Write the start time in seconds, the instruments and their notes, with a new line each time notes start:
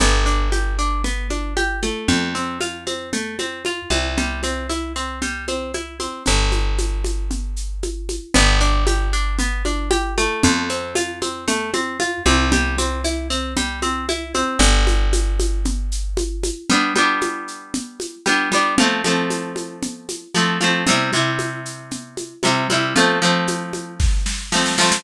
0.00 electric bass (finger) G1, pizzicato strings B3, low conga, shaker
0.26 pizzicato strings D4, shaker
0.52 pizzicato strings G4, high conga, shaker
0.79 pizzicato strings D4, shaker
1.04 pizzicato strings B3, low conga, shaker
1.30 pizzicato strings D4, high conga, shaker
1.57 pizzicato strings G4, high conga, shaker
1.82 pizzicato strings A3, high conga, shaker
2.08 electric bass (finger) F2, low conga, shaker
2.35 pizzicato strings C4, shaker
2.61 pizzicato strings F4, high conga, shaker
2.87 pizzicato strings C4, high conga, shaker
3.13 pizzicato strings A3, low conga, shaker
3.39 pizzicato strings C4, high conga, shaker
3.65 pizzicato strings F4, high conga, shaker
3.90 electric bass (finger) C2, pizzicato strings C4, high conga, shaker
4.17 pizzicato strings G3, low conga, shaker
4.43 pizzicato strings C4, high conga, shaker
4.69 pizzicato strings E4, high conga, shaker
4.96 pizzicato strings C4, shaker
5.22 pizzicato strings G3, low conga, shaker
5.48 pizzicato strings C4, high conga, shaker
5.74 pizzicato strings E4, high conga, shaker
6.00 pizzicato strings C4, high conga, shaker
6.26 electric bass (finger) G1, low conga, shaker
6.52 high conga, shaker
6.78 high conga, shaker
7.04 high conga, shaker
7.31 low conga, shaker
7.56 shaker
7.83 high conga, shaker
8.09 high conga, shaker
8.34 electric bass (finger) G1, pizzicato strings B3, low conga, shaker
8.60 pizzicato strings D4, shaker
8.87 pizzicato strings G4, high conga, shaker
9.13 pizzicato strings D4, shaker
9.39 pizzicato strings B3, low conga, shaker
9.65 pizzicato strings D4, high conga, shaker
9.91 pizzicato strings G4, high conga, shaker
10.18 pizzicato strings A3, high conga, shaker
10.43 electric bass (finger) F2, low conga, shaker
10.69 pizzicato strings C4, shaker
10.95 pizzicato strings F4, high conga, shaker
11.22 pizzicato strings C4, high conga, shaker
11.48 pizzicato strings A3, low conga, shaker
11.73 pizzicato strings C4, high conga, shaker
12.00 pizzicato strings F4, high conga, shaker
12.25 electric bass (finger) C2, pizzicato strings C4, high conga, shaker
12.52 pizzicato strings G3, low conga, shaker
12.78 pizzicato strings C4, high conga, shaker
13.04 pizzicato strings E4, high conga, shaker
13.30 pizzicato strings C4, shaker
13.56 pizzicato strings G3, low conga, shaker
13.82 pizzicato strings C4, high conga, shaker
14.09 pizzicato strings E4, high conga, shaker
14.34 pizzicato strings C4, high conga, shaker
14.59 electric bass (finger) G1, low conga, shaker
14.87 high conga, shaker
15.13 high conga, shaker
15.40 high conga, shaker
15.65 low conga, shaker
15.92 shaker
16.17 high conga, shaker
16.43 high conga, shaker
16.70 pizzicato strings G3 B3 D4, low conga, shaker
16.95 pizzicato strings G3 B3 D4, high conga, shaker
17.21 high conga, shaker
17.48 shaker
17.74 low conga, shaker
18.00 high conga, shaker
18.26 pizzicato strings G3 B3 D4, high conga, shaker
18.52 pizzicato strings G3 B3 D4, high conga, shaker
18.78 pizzicato strings F3 A3 C4, low conga, shaker
19.04 pizzicato strings F3 A3 C4, high conga, shaker
19.30 high conga, shaker
19.56 high conga, shaker
19.82 low conga, shaker
20.09 high conga, shaker
20.34 pizzicato strings F3 A3 C4, high conga, shaker
20.61 pizzicato strings F3 A3 C4, high conga, shaker
20.87 pizzicato strings C3 G3 E4, low conga, shaker
21.13 pizzicato strings C3 G3 E4, high conga, shaker
21.39 high conga, shaker
21.65 shaker
21.91 low conga, shaker
22.17 high conga, shaker
22.43 pizzicato strings C3 G3 E4, high conga, shaker
22.70 pizzicato strings C3 G3 E4, high conga, shaker
22.96 pizzicato strings F3 A3 C4, low conga, shaker
23.22 pizzicato strings F3 A3 C4, shaker
23.47 high conga, shaker
23.73 high conga, shaker
24.00 kick, snare
24.26 snare
24.52 pizzicato strings F3 A3 C4, snare
24.66 snare
24.78 pizzicato strings F3 A3 C4, snare
24.92 snare